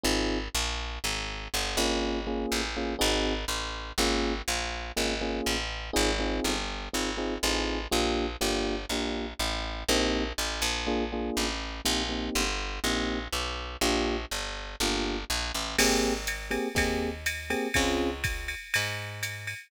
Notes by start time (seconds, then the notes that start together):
0.04 G#1 C4 D#4 F4 G#4
0.55 A#1
1.04 G#1
1.54 G1
1.77 G#1 A#3 C#4 F4 G#4
2.27 A#3 C#4 F4 G#4
2.52 A1
2.77 A#3 C#4 F4 G#4
2.99 G#1 C4 D#4 F#4 G#4
3.48 A1
3.98 G#1 A#3 C#4 F4 G#4
4.48 A#1
4.97 G#1 A#3 C#4 F4 G#4
5.21 A#3 C#4 F4 G#4
5.46 A1
5.93 G#1 C4 D#4 F4 G#4
6.19 C4 D#4 F4 G#4
6.44 G1
6.93 G#1 C4 D#4 F4 G#4
7.17 C4 D#4 F4 G#4
7.43 A1 C4 D#4 F4 G#4
7.91 A#1 A#3 D4 F4 G4
8.41 G1 A#3 D4 F4 G4
8.89 A#1 A#3 D4 F4 G4
9.39 A1
9.89 A#1 A#3 C4 D#4 G4
10.38 A1
10.62 A#1
10.87 A#3 D4 F4 G#4
11.12 A#3 D4 F4 G#4
11.37 A1
11.85 A#1 A#3 C4 D#4 G4
12.09 A#3 C4 D#4 G4
12.35 G1
12.84 A#1 A#3 C4 D#4 G4
13.33 B1
13.81 A#1 A#3 D4 F4 G4
14.31 G1
14.80 G1 A#3 D4 F4 G4
15.30 A#1
15.55 A1
15.78 G#1 A#3 C4 G4 G#4, crash, ride
16.27 hi-hat pedal, ride
16.51 A#3 C4 G4 G#4, ride
16.75 D#2 A#3 C4 G4 G#4, kick, ride
17.26 hi-hat pedal, ride
17.50 A#3 C4 G4 G#4, ride
17.74 C#2 C4 C#4 F4 G#4, kick, ride
18.24 kick, hi-hat pedal, ride
18.48 ride
18.74 G#2, ride
19.23 hi-hat pedal, ride
19.47 ride